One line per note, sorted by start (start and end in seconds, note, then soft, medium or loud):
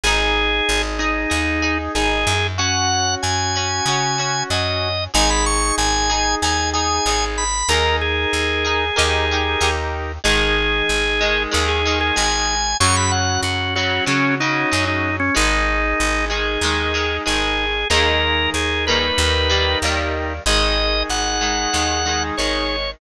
0.03 0.61 G#1 loud
0.03 2.33 D#4 medium
0.03 0.93 D#4 medium
0.03 2.33 G#4 medium
0.03 0.82 G#4 medium
0.03 0.93 G#4 medium
0.69 1.26 G#1 medium
0.99 1.78 D#4 medium
0.99 1.28 D#4 medium
0.99 1.28 G#4 medium
1.30 1.89 D#2 medium
1.30 1.59 D#4 medium
1.30 1.59 G#4 medium
1.62 1.91 D#4 medium
1.62 1.91 G#4 medium
1.95 2.25 G#1 medium
1.95 2.53 D#4 medium
1.95 2.53 G#4 medium
1.95 2.47 G#4 medium
2.27 3.16 F#2 loud
2.58 4.89 C#4 medium
2.58 3.46 C#4 medium
2.58 3.46 F#4 medium
2.58 4.89 F#4 medium
2.58 3.15 F#5 medium
3.22 3.81 F#2 medium
3.22 4.43 G#5 medium
3.55 3.85 C#4 medium
3.55 3.85 F#4 medium
3.86 4.43 C#3 medium
3.86 4.16 C#4 medium
3.86 4.16 F#4 medium
4.18 4.47 C#4 medium
4.18 4.47 F#4 medium
4.50 5.08 F#2 medium
4.50 5.10 C#4 medium
4.50 5.10 F#4 medium
4.50 5.04 D#5 medium
5.13 5.72 G#1 loud
5.13 7.44 D#4 medium
5.13 6.01 D#4 medium
5.13 6.01 G#4 medium
5.13 7.44 G#4 medium
5.13 5.30 G#5 medium
5.30 5.45 B5 medium
5.46 5.75 C#6 medium
5.78 6.35 G#1 medium
5.78 6.35 G#5 medium
6.09 6.39 D#4 medium
6.09 6.39 G#4 medium
6.42 7.00 D#2 medium
6.42 6.72 D#4 medium
6.42 6.72 G#4 medium
6.42 6.70 G#5 medium
6.73 7.03 D#4 medium
6.73 7.03 G#4 medium
6.73 7.25 G#5 medium
7.06 7.63 G#1 medium
7.06 7.65 D#4 medium
7.06 7.65 G#4 medium
7.38 7.69 B5 medium
7.68 8.26 D#2 loud
7.68 8.84 D#4 medium
7.68 8.57 D#4 medium
7.68 8.84 G#4 medium
7.68 8.57 G#4 medium
7.68 7.96 A#4 medium
7.68 8.57 A#4 loud
7.68 8.84 A#4 medium
8.01 9.70 G#4 medium
8.33 8.91 D#2 medium
8.64 8.94 D#4 medium
8.64 8.94 G#4 medium
8.64 8.94 A#4 medium
8.96 9.56 D#2 loud
8.96 10.12 D#4 medium
8.96 9.25 D#4 loud
8.96 9.25 G4 medium
8.96 10.12 G4 medium
8.96 9.25 A#4 medium
8.96 10.12 A#4 medium
9.31 9.60 D#4 medium
9.31 9.60 G4 medium
9.31 9.60 A#4 medium
9.60 10.18 D#2 medium
9.60 10.19 D#4 medium
9.60 10.19 G4 medium
9.60 10.19 A#4 medium
10.24 10.82 G#1 medium
10.24 11.12 D#3 medium
10.24 11.12 G#3 medium
10.24 12.55 D#4 medium
10.24 12.55 G#4 medium
10.24 11.43 G#4 medium
10.89 11.47 G#1 medium
11.20 11.50 D#3 medium
11.20 11.50 G#3 medium
11.51 12.12 D#2 loud
11.51 11.80 D#3 medium
11.51 11.80 G#3 medium
11.68 11.99 G#4 medium
11.85 12.15 D#3 medium
11.85 12.15 G#3 medium
12.01 12.16 G#4 medium
12.16 12.75 G#1 medium
12.16 12.74 D#3 medium
12.16 12.74 G#3 medium
12.16 12.77 G#5 medium
12.80 13.38 F#2 loud
12.80 13.68 C#3 medium
12.80 13.68 F#3 loud
12.80 15.10 C#4 medium
12.80 15.10 F#4 medium
12.80 12.96 C#6 medium
12.96 13.11 B5 medium
13.12 13.41 F#5 medium
13.43 14.00 F#2 medium
13.43 13.74 F#4 medium
13.75 14.05 C#3 medium
13.75 14.05 F#3 medium
13.75 14.05 F#4 medium
14.06 14.36 C#3 medium
14.06 14.65 C#3 medium
14.06 14.36 F#3 medium
14.06 14.35 C#4 medium
14.40 14.70 C#3 medium
14.40 14.70 F#3 medium
14.40 14.85 D#4 medium
14.71 15.30 F#2 medium
14.71 15.30 C#3 medium
14.71 15.30 F#3 medium
14.87 15.16 D#4 medium
15.20 15.35 C#4 medium
15.34 15.94 G#1 loud
15.34 16.22 D#3 medium
15.34 16.22 G#3 medium
15.34 17.65 D#4 medium
15.34 16.25 D#4 medium
15.34 17.65 G#4 medium
16.00 16.57 G#1 medium
16.29 16.59 D#3 medium
16.29 16.59 G#3 medium
16.29 17.17 G#4 medium
16.61 17.19 D#2 medium
16.61 16.92 D#3 medium
16.61 16.92 G#3 medium
16.93 17.23 D#3 medium
16.93 17.23 G#3 medium
17.25 17.85 G#1 medium
17.25 17.84 D#3 medium
17.25 17.84 G#3 medium
17.25 17.88 G#4 medium
17.90 18.48 D#2 medium
17.90 18.78 D#3 loud
17.90 18.78 G#3 loud
17.90 18.78 A#3 loud
17.90 19.05 D#4 medium
17.90 19.05 G#4 medium
17.90 18.50 A#4 medium
17.90 19.05 A#4 medium
18.54 19.11 D#2 medium
18.54 18.85 G#4 medium
18.87 19.49 D#3 medium
18.87 19.49 G3 medium
18.87 19.49 A#3 loud
18.87 19.78 B4 medium
19.18 19.75 D#2 loud
19.18 20.33 D#4 medium
19.18 20.33 G4 medium
19.18 20.33 A#4 medium
19.49 19.79 D#3 medium
19.49 19.79 G3 medium
19.49 19.79 A#3 medium
19.82 20.39 D#2 medium
19.82 20.41 D#3 medium
19.82 20.41 G3 medium
19.82 20.41 A#3 medium
20.46 21.03 G#1 loud
20.46 21.35 D#3 medium
20.46 21.35 G#3 medium
20.46 22.76 D#4 medium
20.46 22.76 G#4 medium
20.46 21.03 D#5 medium
21.09 21.67 G#1 medium
21.09 22.23 F#5 medium
21.41 21.70 D#3 medium
21.41 21.70 G#3 medium
21.73 22.31 D#2 medium
21.73 22.02 D#3 medium
21.73 22.02 G#3 medium
22.05 22.34 D#3 medium
22.05 22.34 G#3 medium
22.37 22.96 G#1 medium
22.37 22.97 D#3 medium
22.37 22.97 G#3 medium
22.37 22.91 C#5 medium